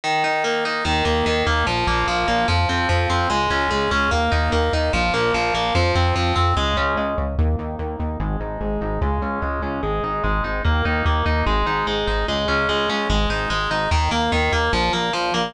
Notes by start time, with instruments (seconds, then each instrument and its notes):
0.04 overdriven guitar D#3
0.24 overdriven guitar D#4
0.44 overdriven guitar A#3
0.65 overdriven guitar D#4
0.85 synth bass 1 D#2, overdriven guitar D#3
1.05 synth bass 1 D#2, overdriven guitar A#3
1.26 synth bass 1 D#2, overdriven guitar D#3
1.47 synth bass 1 D#2, overdriven guitar A#3
1.67 synth bass 1 A#1, overdriven guitar F3
1.87 synth bass 1 A#1, overdriven guitar A#3
2.08 synth bass 1 A#1, overdriven guitar F3
2.28 synth bass 1 A#1, overdriven guitar A#3
2.48 synth bass 1 F2, overdriven guitar F3
2.69 synth bass 1 F2, overdriven guitar C4
2.89 synth bass 1 F2, overdriven guitar F3
3.10 synth bass 1 F2, overdriven guitar C4
3.30 synth bass 1 C#2, overdriven guitar G#3
3.50 synth bass 1 C#2, overdriven guitar C#4
3.71 synth bass 1 C#2, overdriven guitar G#3
3.91 synth bass 1 C#2, overdriven guitar C#4
4.11 synth bass 1 D#2, overdriven guitar A#3
4.32 synth bass 1 D#2, overdriven guitar D#4
4.52 synth bass 1 D#2, overdriven guitar A#3
4.73 synth bass 1 D#2, overdriven guitar D#4
4.93 synth bass 1 A#1, overdriven guitar F3
5.14 synth bass 1 A#1, overdriven guitar A#3
5.34 synth bass 1 A#1, overdriven guitar F3
5.54 synth bass 1 A#1, overdriven guitar A#3
5.75 synth bass 1 F2, overdriven guitar F3
5.95 synth bass 1 F2, overdriven guitar C4
6.15 synth bass 1 F2, overdriven guitar F3
6.36 synth bass 1 F2, overdriven guitar C4
6.57 synth bass 1 C#2, overdriven guitar G#3
6.77 synth bass 1 C#2, overdriven guitar C#4
6.97 synth bass 1 C#2, overdriven guitar G#3
7.18 synth bass 1 C#2, overdriven guitar C#4
7.38 synth bass 1 D#2, overdriven guitar A#3
7.59 synth bass 1 D#2, overdriven guitar D#4
7.79 synth bass 1 D#2, overdriven guitar A#3
7.99 synth bass 1 D#2, overdriven guitar D#4
8.20 synth bass 1 G#1, overdriven guitar G#3
8.40 synth bass 1 G#1, overdriven guitar D#4
8.61 synth bass 1 G#1, overdriven guitar G#3
8.81 synth bass 1 G#1, overdriven guitar D#4
9.01 synth bass 1 C#2, overdriven guitar G#3
9.22 synth bass 1 C#2, overdriven guitar C#4
9.42 synth bass 1 C#2, overdriven guitar G#3
9.62 synth bass 1 C#2, overdriven guitar C#4
9.83 synth bass 1 G#1, overdriven guitar G#3
10.03 synth bass 1 G#1, overdriven guitar D#4
10.24 synth bass 1 G#1, overdriven guitar G#3
10.44 synth bass 1 G#1, overdriven guitar D#4
10.64 synth bass 1 D#2, overdriven guitar A#3
10.85 synth bass 1 D#2, overdriven guitar D#4
11.05 synth bass 1 D#2, overdriven guitar A#3
11.26 synth bass 1 D#2, overdriven guitar D#4
11.46 synth bass 1 G#1, overdriven guitar G#3
11.67 synth bass 1 G#1, overdriven guitar D#4
11.87 synth bass 1 G#1, overdriven guitar G#3
12.07 synth bass 1 G#1, overdriven guitar D#4
12.28 synth bass 1 C#2, overdriven guitar G#3
12.48 synth bass 1 C#2, overdriven guitar C#4
12.69 synth bass 1 C#2, overdriven guitar G#3
12.89 synth bass 1 C#2, overdriven guitar C#4
13.10 synth bass 1 G#1, overdriven guitar G#3
13.30 synth bass 1 G#1, overdriven guitar D#4
13.50 synth bass 1 G#1, overdriven guitar G#3
13.71 synth bass 1 G#1, overdriven guitar D#4
13.91 synth bass 1 D#2, overdriven guitar D#3
14.11 synth bass 1 D#2, overdriven guitar A#3
14.32 synth bass 1 D#2, overdriven guitar D#3
14.52 synth bass 1 D#2, overdriven guitar A#3
14.73 synth bass 1 A#1, overdriven guitar F3
14.93 synth bass 1 A#1, overdriven guitar A#3
15.13 synth bass 1 A#1, overdriven guitar F3
15.34 synth bass 1 A#1, overdriven guitar A#3